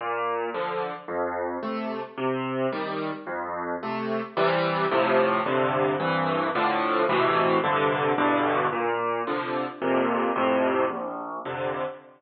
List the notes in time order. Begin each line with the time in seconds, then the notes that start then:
0.01 A#2
0.54 D3 F3
1.08 F2
1.63 C3 A3
2.18 C3
2.72 D#3 G3
3.27 F2
3.83 C3 A3
4.37 C3 E3 G3
4.91 A2 C3 F3
5.46 G2 C3 D3
6.00 C2 G2 E3
6.55 A2 D3 F3
7.09 A2 B2 C3 E3
7.64 G2 C3 D3
8.18 E2 G2 B2 D3
8.73 A#2
9.27 C3 D3 F3
9.82 F2 A#2 C3
10.36 F2 A2 C3
10.90 A#1
11.45 F2 C3 D3